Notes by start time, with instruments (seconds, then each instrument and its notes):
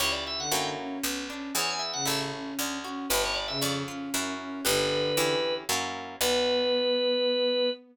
0.00 harpsichord C#2, orchestral harp C#4 E4 G4, drawbar organ C#5
0.12 drawbar organ D5
0.27 drawbar organ E5
0.39 violin D3, drawbar organ F#5
0.52 harpsichord F#2, orchestral harp A#3 C#4 E4 F#4, drawbar organ G5
0.78 violin C#4
1.03 harpsichord B1, orchestral harp B3
1.29 violin C#4, orchestral harp D4
1.55 harpsichord E2, orchestral harp B3 E4 G#4, drawbar organ C#5
1.70 drawbar organ G#5
1.79 drawbar organ E5
1.93 violin C#3, drawbar organ F#5
2.05 harpsichord A1, orchestral harp C#4 E4 A4, drawbar organ E5
2.32 violin C#4
2.59 harpsichord D2, orchestral harp D4
2.84 violin C#4, orchestral harp F#4
3.10 harpsichord G1, orchestral harp D4 G4 B4, drawbar organ B4
3.24 drawbar organ C#5
3.35 drawbar organ D5
3.48 violin C#3, drawbar organ E5
3.61 harpsichord F2, orchestral harp C#4, drawbar organ D5
3.88 violin C#4, orchestral harp F4
4.14 harpsichord F#2, orchestral harp C#4 E4 F#4 A#4
4.40 violin C#4
4.65 harpsichord G1, violin D3, orchestral harp D4 G4 B4, drawbar organ B4
5.17 harpsichord E2, orchestral harp C#4 E4 G4
5.69 harpsichord F#2, orchestral harp A#3 C#4 E4 F#4
6.21 harpsichord B1, orchestral harp B3 D4 F#4, violin B3, drawbar organ B4